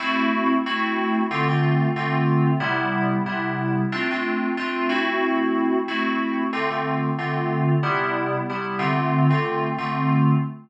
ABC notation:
X:1
M:4/4
L:1/16
Q:"Swing 16ths" 1/4=92
K:Am
V:1 name="Electric Piano 2"
[A,CE^F]4 [A,CEF]4 [D,A,C=F] [D,A,CF]3 [D,A,CF]4 | [C,G,B,E]4 [C,G,B,E]4 [A,CDF] [A,CDF]3 [A,CDF]2 [A,CE^F]2- | [A,CE^F]4 [A,CEF]4 [D,A,C=F] [D,A,CF]3 [D,A,CF]4 | [C,G,B,E]4 [C,G,B,E]2 [D,A,CF]3 [D,A,CF]3 [D,A,CF]4 |
z16 |]